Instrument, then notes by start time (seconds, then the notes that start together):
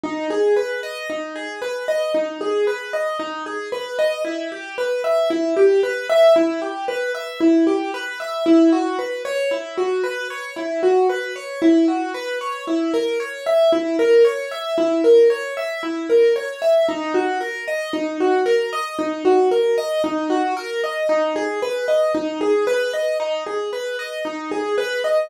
acoustic grand piano
0.03 D#4
0.30 G#4
0.56 B4
0.83 D#5
1.10 D#4
1.36 G#4
1.62 B4
1.88 D#5
2.14 D#4
2.41 G#4
2.67 B4
2.93 D#5
3.19 D#4
3.46 G#4
3.72 B4
3.98 D#5
4.25 E4
4.52 G4
4.78 B4
5.04 E5
5.30 E4
5.56 G4
5.83 B4
6.09 E5
6.36 E4
6.62 G4
6.88 B4
7.14 E5
7.40 E4
7.67 G4
7.94 B4
8.20 E5
8.46 E4
8.72 F#4
8.98 B4
9.25 C#5
9.51 E4
9.77 F#4
10.04 B4
10.30 C#5
10.56 E4
10.83 F#4
11.09 B4
11.36 C#5
11.62 E4
11.88 F#4
12.14 B4
12.41 C#5
12.67 E4
12.94 A#4
13.20 C#5
13.46 E5
13.72 E4
13.99 A#4
14.25 C#5
14.51 E5
14.78 E4
15.04 A#4
15.30 C#5
15.57 E5
15.83 E4
16.09 A#4
16.36 C#5
16.62 E5
16.88 D#4
17.14 F#4
17.41 A#4
17.68 D#5
17.93 D#4
18.20 F#4
18.46 A#4
18.73 D#5
18.98 D#4
19.25 F#4
19.51 A#4
19.78 D#5
20.04 D#4
20.30 F#4
20.57 A#4
20.84 D#5
21.09 D#4
21.36 G#4
21.62 B4
21.88 D#5
22.14 D#4
22.41 G#4
22.67 B4
22.93 D#5
23.20 D#4
23.46 G#4
23.73 B4
23.99 D#5
24.25 D#4
24.51 G#4
24.78 B4
25.04 D#5